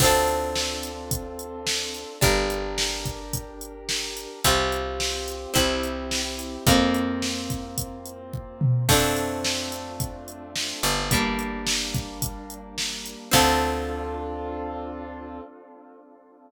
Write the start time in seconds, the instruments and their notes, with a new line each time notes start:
0.00 electric bass (finger) D2, acoustic grand piano C4 D4 F4 A4, acoustic guitar (steel) C4 D4, kick, crash
0.04 acoustic guitar (steel) F4 A4
0.28 closed hi-hat
0.56 snare
0.83 closed hi-hat
1.11 kick, closed hi-hat
1.39 closed hi-hat
1.67 snare
1.94 closed hi-hat
2.21 electric bass (finger) G1, acoustic guitar (steel) D4 G4 A#4, acoustic grand piano D4 G4 A#4, kick, closed hi-hat
2.50 closed hi-hat
2.78 snare
3.05 kick, closed hi-hat
3.33 kick, closed hi-hat
3.61 closed hi-hat
3.89 snare
4.17 closed hi-hat
4.44 electric bass (finger) C2, acoustic grand piano C4 F4 G4, acoustic guitar (steel) C4 F4 G4, kick, closed hi-hat
4.72 closed hi-hat
5.00 snare
5.28 closed hi-hat
5.54 electric bass (finger) C2, acoustic guitar (steel) C4 E4 G4, acoustic grand piano C4 E4 G4, kick, closed hi-hat
5.83 closed hi-hat
6.11 snare
6.39 closed hi-hat
6.66 electric bass (finger) F2, acoustic grand piano A#3 C4 F4, acoustic guitar (steel) A#3 C4 F4, kick, closed hi-hat
6.94 closed hi-hat
7.22 snare
7.50 kick, closed hi-hat
7.78 kick, closed hi-hat
8.06 closed hi-hat
8.33 kick
8.61 mid tom
8.88 electric bass (finger) F2, acoustic grand piano A3 C4 D4 F4, acoustic guitar (steel) A3 C4 D4 F4, kick, crash
9.17 closed hi-hat
9.44 snare
9.72 closed hi-hat
10.00 kick, closed hi-hat
10.28 closed hi-hat
10.56 snare
10.83 electric bass (finger) G1, closed hi-hat
11.10 acoustic grand piano G3 A#3 D4, acoustic guitar (steel) G3 A#3, kick, closed hi-hat
11.14 acoustic guitar (steel) D4
11.39 closed hi-hat
11.67 snare
11.94 kick, closed hi-hat
12.22 kick, closed hi-hat
12.50 closed hi-hat
12.78 snare
13.06 closed hi-hat
13.31 electric bass (finger) D2, acoustic guitar (steel) C4 D4 F4 A4, acoustic grand piano C4 D4 F4 A4, kick, crash